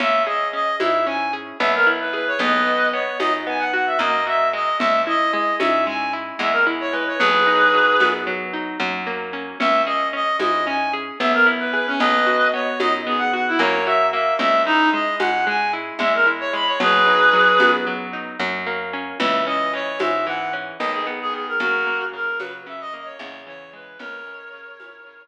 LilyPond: <<
  \new Staff \with { instrumentName = "Clarinet" } { \time 9/8 \key cis \dorian \tempo 4. = 75 e''8 dis''8 dis''8 e''8 gis''8 r8 e''16 ais'16 r16 b'16 b'16 cis''16 | <b' dis''>4 cis''8 dis''16 r16 gis''16 fis''16 fis''16 e''16 dis''8 e''8 dis''8 | e''8 dis''8 dis''8 e''8 gis''8 r8 e''16 ais'16 r16 cis''16 b'16 cis''16 | <gis' b'>2 r2 r8 |
e''8 dis''8 dis''8 dis''8 gis''8 r8 e''16 ais'16 r16 b'16 b'16 cis'16 | <b' dis''>4 cis''8 dis''16 r16 gis'16 fis''16 fis''16 e'16 cis''8 e''8 e''8 | e''8 dis'8 dis''8 fis''8 gis''8 r8 e''16 ais'16 r16 cis''16 b''16 cis''16 | <gis' b'>2 r2 r8 |
e''8 dis''8 cis''8 e''8 fis''8 r8 dis''16 gis'16 r16 gis'16 gis'16 ais'16 | <fis' ais'>4 ais'8 b'16 r16 e''16 dis''16 dis''16 cis''16 cis''8 cis''8 b'8 | <ais' cis''>2~ <ais' cis''>8 r2 | }
  \new Staff \with { instrumentName = "Acoustic Guitar (steel)" } { \time 9/8 \key cis \dorian cis'8 gis'8 cis'8 e'8 cis'8 gis'8 b8 e'8 gis'8 | b8 fis'8 b8 dis'8 b8 fis'8 ais8 fis'8 gis8~ | gis8 e'8 gis8 cis'8 gis8 e'8 gis8 e'8 gis8 | fis8 dis'8 fis8 b8 fis8 dis'8 fis8 ais8 cis'8 |
cis'8 gis'8 cis'8 e'8 cis'8 gis'8 b8 e'8 gis'8 | b8 fis'8 b8 dis'8 b8 fis'8 ais8 fis'8 ais8 | gis8 e'8 gis8 cis'8 gis8 e'8 gis8 e'8 gis8 | fis8 dis'8 fis8 b8 fis8 dis'8 fis8 ais8 cis'8 |
e8 cis'8 e8 gis8 e8 cis'8 dis8 b8 dis8 | cis8 ais8 cis8 fis8 cis8 ais8 cis8 e8 gis8 | cis8 gis8 cis8 e8 cis8 r2 | }
  \new Staff \with { instrumentName = "Electric Bass (finger)" } { \clef bass \time 9/8 \key cis \dorian cis,4. gis,4. b,,4. | b,,4. fis,4. fis,4. | cis,4. gis,4. e,4. | b,,4. fis,4. fis,4. |
cis,4. gis,4. b,,4. | b,,4. fis,4. fis,4. | cis,4. gis,4. e,4. | b,,4. fis,4. fis,4. |
cis,4. gis,4. b,,4. | fis,4. cis4. e,4. | cis,4. gis,4. r4. | }
  \new DrumStaff \with { instrumentName = "Drums" } \drummode { \time 9/8 cgl4. <cgho tamb>4. cgl4. | cgl4. <cgho tamb>4. cgl4. | cgl4. <cgho tamb>4. cgl4. | cgl4. <cgho tamb>4. cgl4. |
cgl4. <cgho tamb>4. cgl4. | cgl4. <cgho tamb>4. cgl4. | cgl4. <cgho tamb>4. cgl4. | cgl4. <cgho tamb>4. cgl4. |
cgl4. <cgho tamb>4. cgl4. | cgl4. <cgho tamb>4. cgl4. | cgl4. <cgho tamb>4. r4. | }
>>